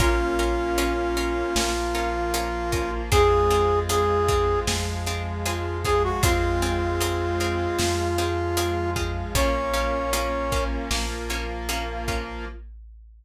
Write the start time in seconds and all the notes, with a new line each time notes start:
0.00 A#1 A#3 C#4 F4 A#4, kick, closed hi-hat
0.39 C#4 F4 A#4, closed hi-hat
0.78 C#4 F4 A#4, closed hi-hat
1.17 C#4 F4 A#4, closed hi-hat
1.56 A#1 F3 A#3 C#4 F4 A#4, snare
1.95 C#4 F4 A#4, closed hi-hat
2.34 C#4 F4 A#4, closed hi-hat
2.72 C#4 F4 A#4, kick, closed hi-hat
3.12 F2 G#3 C4 F4 G#4, kick, closed hi-hat
3.50 C4 F4 G#4, closed hi-hat
3.89 C4 F4 G#4, closed hi-hat
4.28 C4 F4 G#4, kick, closed hi-hat
4.67 F2 F3 G#3 C4 F4 G#4, snare
5.06 C4 F4 G#4, closed hi-hat
5.45 C4 F4 G#4, closed hi-hat
5.84 C4 F4 G#4, kick, closed hi-hat
6.04 F#4
6.23 F2 G#3 C4 F4 G#4, kick, closed hi-hat
6.62 C4 F4 G#4, closed hi-hat
7.00 C4 F4 G#4, closed hi-hat
7.40 C4 F4 G#4, closed hi-hat
7.79 F2 F3 G#3 C4 F4 G#4, snare
8.18 C4 F4 G#4, closed hi-hat
8.57 C4 F4 G#4, closed hi-hat
8.96 C4 F4 G#4, kick, closed hi-hat
9.35 A#1 A#3 C#4 F4 C#5, kick, closed hi-hat
9.74 A#3 C#4 F4, closed hi-hat
10.13 A#3 C#4 F4, closed hi-hat
10.52 A#3 C#4 F4, kick, closed hi-hat
10.91 A#1 F3 A#3 C#4 F4, snare
11.30 A#3 C#4 F4, closed hi-hat
11.69 A#3 C#4 F4, closed hi-hat
12.08 A#3 C#4 F4, kick, closed hi-hat